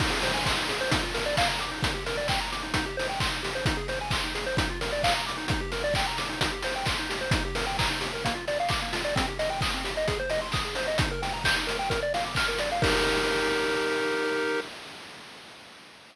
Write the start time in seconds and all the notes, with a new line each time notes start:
0.00 D#4, kick, crash
0.10 G#4
0.22 C5, open hi-hat
0.34 G#5
0.46 C6, kick, clap
0.57 D#4
0.69 G#4, open hi-hat
0.81 C5
0.91 D#4, kick, closed hi-hat
1.03 F4
1.14 A#4, open hi-hat
1.26 D5
1.37 F5, kick, clap
1.49 A#5
1.59 D6, open hi-hat
1.71 D#4
1.83 D#4, kick, closed hi-hat
1.94 G4
2.06 A#4, open hi-hat
2.17 D5
2.28 G5, kick, clap
2.40 A#5
2.52 D6, open hi-hat
2.63 D#4
2.74 D#4, kick, closed hi-hat
2.86 G4
2.97 C5, open hi-hat
3.09 G5
3.20 C6, kick, clap
3.31 D#4
3.43 G4, open hi-hat
3.55 C5
3.65 D#4, kick, closed hi-hat
3.77 G#4
3.88 C5, open hi-hat
4.01 G#5
4.10 C6, kick, clap
4.24 D#4
4.35 G#4, open hi-hat
4.46 C5
4.57 D#4, kick, closed hi-hat
4.70 F4
4.81 A#4, open hi-hat
4.92 D5
5.03 F5, kick, clap
5.15 A#5
5.27 D6, open hi-hat
5.38 D#4
5.48 D#4, kick, closed hi-hat
5.61 G4
5.72 A#4, open hi-hat
5.84 D5
5.94 G5, kick, clap
6.07 A#5
6.18 D6, open hi-hat
6.29 D#4
6.41 D#4, kick, closed hi-hat
6.52 G4
6.62 C5, open hi-hat
6.76 G5
6.86 C6, kick, clap
6.99 D#4
7.10 G4, open hi-hat
7.21 C5
7.31 D#4, kick, closed hi-hat
7.45 G4
7.55 A#4, open hi-hat
7.67 G5
7.79 A#5, kick, clap
7.90 D#4
8.01 G4, open hi-hat
8.13 A#4
8.25 A#3, kick, closed hi-hat
8.35 F4
8.48 D5, open hi-hat
8.60 F5
8.69 D6, kick, clap
8.82 A#3
8.93 F4, open hi-hat
9.05 D5
9.16 C4, kick, closed hi-hat
9.27 G4
9.39 D#5, open hi-hat
9.50 G5
9.61 D#6, kick, clap
9.74 C4
9.84 G4, open hi-hat
9.97 D#5
10.08 G#4, kick, closed hi-hat
10.19 C5
10.29 D#5, open hi-hat
10.42 C6
10.52 D#6, kick, clap
10.65 G#4
10.75 C5, open hi-hat
10.87 D#5
10.98 D#4, kick, closed hi-hat
11.11 A#4
11.22 G5, open hi-hat
11.34 A#5
11.44 G6, kick, clap
11.56 D#4
11.67 A#4, open hi-hat
11.79 G5
11.90 A#4, kick, closed hi-hat
12.03 D5
12.14 F5, open hi-hat
12.25 D6
12.35 F6, kick, clap
12.48 A#4
12.58 D5, open hi-hat
12.72 F5
12.82 D#4 G4 A#4, kick, crash